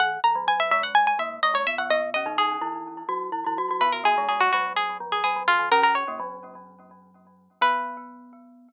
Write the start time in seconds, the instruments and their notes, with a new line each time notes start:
0.00 glockenspiel D#2 D#3, harpsichord F#5
0.24 glockenspiel E2 E3, harpsichord A#5
0.35 glockenspiel F#2 F#3
0.47 glockenspiel F#2 F#3, harpsichord G#5
0.60 harpsichord E5
0.71 glockenspiel G#2 G#3, harpsichord E5
0.83 harpsichord F#5
0.95 harpsichord G#5
1.07 harpsichord G#5
1.19 glockenspiel A#2 A#3, harpsichord E5
1.43 glockenspiel G#2 G#3, harpsichord D#5
1.54 glockenspiel G#2 G#3, harpsichord C#5
1.67 glockenspiel B2 B3, harpsichord E5
1.78 glockenspiel B2 B3, harpsichord F#5
1.90 glockenspiel B2 B3, harpsichord D#5
2.14 glockenspiel C#3 C#4, harpsichord D#5
2.26 glockenspiel D#3 D#4
2.38 glockenspiel D#3 D#4, harpsichord G#4
2.61 glockenspiel E3 E4
3.09 glockenspiel F#3 F#4
3.32 glockenspiel E3 E4
3.46 glockenspiel E3 E4
3.58 glockenspiel F#3 F#4
3.71 glockenspiel F#3 F#4
3.81 glockenspiel B2 B3, harpsichord B4
3.92 harpsichord A#4
4.04 glockenspiel A#2 A#3, harpsichord G#4
4.18 glockenspiel G#2 G#3
4.28 glockenspiel G#2 G#3, harpsichord G#4
4.40 harpsichord F#4
4.52 glockenspiel F#2 F#3, harpsichord F#4
4.76 harpsichord G#4
5.00 glockenspiel F2 F3
5.12 harpsichord G#4
5.24 glockenspiel F#2 F#3, harpsichord G#4
5.36 glockenspiel F#2 F#3
5.48 glockenspiel D#2 D#3, harpsichord F4
5.59 glockenspiel D#2 D#3
5.71 glockenspiel C#3 C#4, harpsichord A#4
5.82 glockenspiel C#3 C#4, harpsichord A#4
5.95 harpsichord C#5
6.08 glockenspiel A#2 A#3
6.20 glockenspiel F#2 F#3
7.61 glockenspiel B3, harpsichord B4